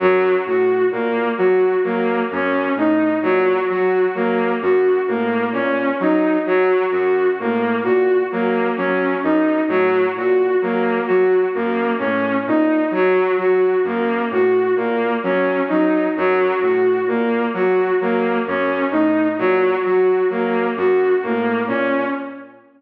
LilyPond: <<
  \new Staff \with { instrumentName = "Ocarina" } { \clef bass \time 6/4 \tempo 4 = 65 ges,8 a,8 bes,8 ges8 ges8 ges,8 a,8 bes,8 ges8 ges8 ges,8 a,8 | bes,8 ges8 ges8 ges,8 a,8 bes,8 ges8 ges8 ges,8 a,8 bes,8 ges8 | ges8 ges,8 a,8 bes,8 ges8 ges8 ges,8 a,8 bes,8 ges8 ges8 ges,8 | a,8 bes,8 ges8 ges8 ges,8 a,8 bes,8 ges8 ges8 ges,8 a,8 bes,8 | }
  \new Staff \with { instrumentName = "Violin" } { \time 6/4 ges8 ges'8 bes8 ges'8 bes8 des'8 ees'8 ges8 ges'8 bes8 ges'8 bes8 | des'8 ees'8 ges8 ges'8 bes8 ges'8 bes8 des'8 ees'8 ges8 ges'8 bes8 | ges'8 bes8 des'8 ees'8 ges8 ges'8 bes8 ges'8 bes8 des'8 ees'8 ges8 | ges'8 bes8 ges'8 bes8 des'8 ees'8 ges8 ges'8 bes8 ges'8 bes8 des'8 | }
>>